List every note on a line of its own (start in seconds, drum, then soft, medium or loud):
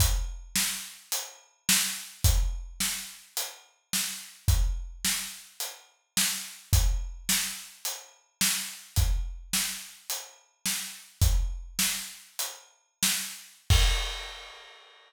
0.00 kick medium
0.00 closed hi-hat loud
0.56 snare loud
1.12 closed hi-hat loud
1.69 snare loud
2.24 kick loud
2.24 closed hi-hat loud
2.80 snare medium
3.37 closed hi-hat loud
3.93 snare medium
4.48 kick loud
4.48 closed hi-hat medium
5.05 snare medium
5.60 closed hi-hat medium
6.17 snare loud
6.73 kick loud
6.73 closed hi-hat loud
7.29 snare loud
7.85 closed hi-hat medium
8.41 snare loud
8.96 kick loud
8.96 closed hi-hat medium
9.53 snare medium
10.10 closed hi-hat medium
10.66 snare medium
11.21 kick loud
11.21 closed hi-hat loud
11.79 snare loud
12.39 closed hi-hat loud
13.03 snare loud
13.70 kick loud
13.70 crash loud